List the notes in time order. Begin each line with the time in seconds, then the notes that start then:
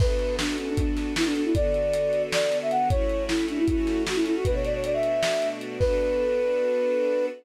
0.00 B3 D4 F#4 A4 B4, kick, crash
0.19 closed hi-hat
0.39 D4, snare
0.58 C#4, closed hi-hat
0.69 D4
0.77 D4, kick, closed hi-hat
0.97 snare, closed hi-hat
1.16 E4, snare
1.25 D4
1.35 D4, closed hi-hat
1.45 E4
1.55 D3 B3 F#4 A4 D5, kick, closed hi-hat
1.74 closed hi-hat
1.94 closed hi-hat
2.13 closed hi-hat
2.32 D5, snare
2.52 closed hi-hat
2.62 E5
2.71 F#5, closed hi-hat
2.90 A3 C#4 E4 F#4 C#5, kick, closed hi-hat
3.10 closed hi-hat
3.28 E4, snare
3.49 D4, closed hi-hat
3.59 E4
3.68 A3 C#4 E4 F#4 A4, kick, closed hi-hat
3.87 snare, closed hi-hat
4.06 F#4, snare
4.15 E4
4.26 E4, closed hi-hat
4.36 F#4
4.45 B2 A3 D4 F#4 B4, kick, closed hi-hat
4.54 C#5
4.64 D5, closed hi-hat
4.75 C#5
4.84 D5, closed hi-hat
4.94 E5
5.03 closed hi-hat
5.23 snare
5.42 closed hi-hat
5.61 closed hi-hat
5.79 B3 D4 F#4 A4 B4, kick, crash